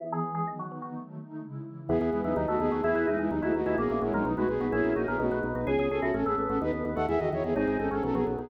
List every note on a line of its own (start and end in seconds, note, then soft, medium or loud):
0.00 0.44 E3 medium
0.00 0.23 E3 medium
0.00 0.23 B3 medium
0.00 0.23 G#4 medium
0.12 0.34 G#4 medium
0.24 0.47 E3 medium
0.24 0.47 G#3 medium
0.24 0.46 B3 medium
0.24 0.47 G#4 medium
0.35 0.46 G#4 medium
0.47 0.70 D#3 medium
0.47 0.92 D#3 medium
0.47 0.71 F#3 medium
0.47 0.70 B3 medium
0.59 0.81 F#4 medium
0.71 0.94 D#3 medium
0.71 0.94 B3 medium
0.71 0.94 D#4 medium
0.82 0.93 F#4 medium
0.94 1.18 D#3 medium
0.94 1.18 F#3 medium
0.94 1.18 A3 medium
1.18 1.42 D#3 medium
1.18 1.42 A3 medium
1.18 1.42 D#4 medium
1.42 1.65 C#3 medium
1.42 1.65 G#3 medium
1.42 1.65 E4 medium
1.65 1.89 C#3 medium
1.65 1.89 E3 medium
1.65 1.89 E4 medium
1.89 1.99 E2 loud
1.89 2.13 B3 medium
1.89 2.12 B3 medium
1.89 2.10 B3 medium
1.89 2.72 B3 loud
1.89 2.12 E4 medium
1.89 2.12 G#4 medium
1.89 2.10 G#4 medium
2.01 2.11 E2 loud
2.01 2.35 G#4 medium
2.11 2.23 E2 medium
2.11 2.22 G#3 medium
2.11 2.36 B3 medium
2.11 2.22 E4 medium
2.11 2.36 G#4 medium
2.11 2.36 B4 medium
2.23 2.34 E2 medium
2.23 2.34 F#3 medium
2.23 2.34 D#4 medium
2.23 2.35 E4 medium
2.35 2.46 D#2 loud
2.35 2.46 F#3 medium
2.35 2.46 D#4 medium
2.35 2.59 D#4 medium
2.35 2.60 D#4 medium
2.35 2.60 F#4 medium
2.35 2.59 A4 medium
2.48 2.58 D#2 medium
2.48 2.59 A3 medium
2.48 2.59 F#4 medium
2.48 2.82 A4 medium
2.59 2.70 D#2 loud
2.59 2.83 A3 medium
2.59 2.81 B3 medium
2.59 2.83 D#4 medium
2.59 2.81 G#4 loud
2.59 2.83 A4 medium
2.71 2.82 D#2 medium
2.71 2.83 F#4 medium
2.83 2.94 E2 loud
2.83 3.06 B3 medium
2.83 3.07 E4 medium
2.83 3.06 E4 loud
2.83 3.06 G#4 loud
2.83 3.07 G#4 medium
2.83 3.07 B4 medium
2.95 3.05 E2 medium
2.95 3.29 B4 medium
3.07 3.17 E2 medium
3.07 3.18 G#3 medium
3.07 3.17 D#4 loud
3.07 3.30 E4 medium
3.07 3.18 E4 medium
3.07 3.30 B4 medium
3.07 3.30 E5 medium
3.18 3.29 E2 medium
3.18 3.30 G#3 medium
3.18 3.28 D#4 medium
3.18 3.30 E4 medium
3.18 3.30 G#4 medium
3.31 3.41 D#2 loud
3.31 3.41 F#3 medium
3.31 3.54 D#4 medium
3.31 3.41 D#4 medium
3.31 3.55 D#4 medium
3.31 3.54 G#4 medium
3.31 3.54 B4 medium
3.42 3.53 D#2 medium
3.42 3.53 A3 medium
3.42 3.53 E4 loud
3.42 3.53 F#4 medium
3.42 3.76 B4 medium
3.54 3.65 D#2 medium
3.54 3.76 A3 medium
3.54 3.78 D#4 medium
3.54 3.76 F#4 medium
3.54 3.78 B4 medium
3.54 3.78 D#5 medium
3.66 3.76 D#2 medium
3.66 3.77 E4 loud
3.66 3.77 G#4 medium
3.78 3.88 A#1 loud
3.78 4.01 A#3 loud
3.78 3.99 B3 medium
3.78 4.23 C#4 medium
3.78 4.01 C#4 medium
3.78 4.01 E4 medium
3.78 4.01 F#4 medium
3.78 3.99 G#4 medium
3.78 4.01 A#4 medium
3.90 4.00 A#1 medium
3.90 4.24 E4 medium
4.01 4.12 A#1 medium
4.01 4.12 G#3 medium
4.01 4.13 G#3 medium
4.01 4.25 C#4 medium
4.01 4.25 E4 medium
4.01 4.13 E4 medium
4.01 4.24 F#4 medium
4.01 4.25 A#4 medium
4.01 4.25 C#5 medium
4.13 4.23 A#1 medium
4.13 4.25 F#3 medium
4.13 4.23 G#3 loud
4.13 4.25 D#4 medium
4.13 4.25 A#4 medium
4.25 4.35 B1 loud
4.25 4.36 F#3 medium
4.25 4.36 D#4 medium
4.25 4.48 D#4 medium
4.25 4.49 D#4 medium
4.25 4.49 F#4 medium
4.25 4.48 B4 medium
4.36 4.47 B1 medium
4.36 4.48 G#3 loud
4.36 4.48 A3 medium
4.36 4.48 F#4 medium
4.36 4.71 B4 medium
4.48 4.59 B1 medium
4.48 4.67 B3 medium
4.48 4.72 B3 medium
4.48 4.72 D#4 medium
4.48 4.67 G#4 medium
4.48 4.72 B4 medium
4.60 4.71 B1 medium
4.60 4.71 B3 loud
4.60 4.72 F#4 medium
4.72 4.83 A#1 loud
4.72 4.93 B3 medium
4.72 5.17 C#4 medium
4.72 4.96 C#4 medium
4.72 4.93 E4 loud
4.72 4.96 E4 medium
4.72 4.96 F#4 medium
4.72 4.93 G#4 loud
4.72 4.96 A#4 medium
4.84 4.94 A#1 medium
4.84 5.17 E4 medium
4.96 5.06 A#1 medium
4.96 5.07 A#3 medium
4.96 5.19 C#4 medium
4.96 5.06 D#4 medium
4.96 5.19 E4 medium
4.96 5.18 F#4 medium
4.96 5.07 F#4 medium
4.96 5.19 A#4 medium
4.96 5.19 C#5 medium
5.07 5.18 A#1 medium
5.07 5.17 B3 medium
5.07 5.31 B3 medium
5.07 5.17 G#4 medium
5.07 5.19 A#4 medium
5.19 5.30 B1 loud
5.19 5.39 A3 medium
5.19 5.44 D#4 medium
5.19 5.43 D#4 medium
5.19 5.39 F#4 medium
5.19 5.43 F#4 medium
5.19 5.43 B4 medium
5.31 5.41 B1 medium
5.31 5.65 B4 medium
5.43 5.53 B1 medium
5.43 5.67 B3 medium
5.43 5.67 D#4 medium
5.43 5.67 B4 medium
5.55 5.65 B1 medium
5.55 5.66 F#4 medium
5.66 5.77 C#2 loud
5.66 5.89 B3 medium
5.66 5.91 C#4 medium
5.66 5.89 G#4 medium
5.66 5.86 G#4 loud
5.79 5.89 C#2 loud
5.79 6.13 G#4 medium
5.90 6.01 C#2 medium
5.90 6.00 C#4 medium
5.90 6.14 C#4 medium
5.90 6.03 G#4 loud
5.90 6.00 A4 medium
6.02 6.12 C#2 medium
6.02 6.11 C#4 medium
6.02 6.13 E4 medium
6.02 6.13 F#4 medium
6.02 6.11 A4 medium
6.14 6.24 A1 loud
6.14 6.25 C#4 medium
6.14 6.37 C#4 medium
6.14 6.25 A4 medium
6.26 6.36 A1 medium
6.26 6.36 B3 loud
6.26 6.36 B3 medium
6.26 6.36 G#4 medium
6.26 6.59 A4 medium
6.38 6.48 A1 medium
6.38 6.59 B3 loud
6.38 6.60 C#4 medium
6.49 6.59 A1 medium
6.49 6.59 C#4 medium
6.49 6.61 F#4 medium
6.49 6.59 A4 medium
6.61 6.72 D#2 loud
6.61 6.84 B3 loud
6.61 6.72 D#4 medium
6.61 6.72 B4 loud
6.73 6.83 D#2 medium
6.85 6.95 D#2 medium
6.85 6.96 B3 loud
6.96 7.07 D#2 medium
6.96 7.07 A3 medium
6.96 7.06 A4 medium
6.96 7.06 F#5 medium
7.08 7.19 E2 loud
7.08 7.20 E3 loud
7.08 7.19 G#4 medium
7.08 7.19 E5 medium
7.19 7.30 E2 medium
7.19 7.32 D#3 medium
7.19 7.30 F#4 medium
7.19 7.30 D#5 medium
7.32 7.43 E2 medium
7.32 7.53 D#3 medium
7.32 7.43 E4 medium
7.32 7.43 C#5 medium
7.44 7.54 E2 medium
7.44 7.54 B3 medium
7.44 7.54 G#4 medium
7.56 7.66 G#1 medium
7.56 7.77 C4 medium
7.56 7.79 C4 medium
7.56 7.78 D#4 loud
7.56 7.77 G#4 loud
7.68 7.78 G#1 medium
7.68 8.01 G#4 medium
7.78 7.90 G#1 medium
7.78 8.02 C4 medium
7.78 7.89 C#4 medium
7.78 7.89 D#4 medium
7.78 7.89 A4 medium
7.91 8.01 G#1 medium
7.91 8.02 C#4 medium
7.91 8.03 C#4 medium
7.91 8.02 F#4 medium
7.91 8.03 A4 medium
8.03 8.13 B1 medium
8.03 8.13 F#3 loud
8.03 8.26 B3 medium
8.03 8.15 C#4 medium
8.03 8.15 A4 loud
8.15 8.25 B1 loud
8.15 8.25 F#3 loud
8.15 8.25 B3 medium
8.15 8.49 F#4 medium
8.15 8.25 G#4 medium
8.26 8.37 B1 medium
8.26 8.49 F#3 medium
8.26 8.49 B3 medium
8.39 8.49 B1 medium
8.39 8.49 B3 medium
8.39 8.50 D#4 medium
8.39 8.49 G#4 medium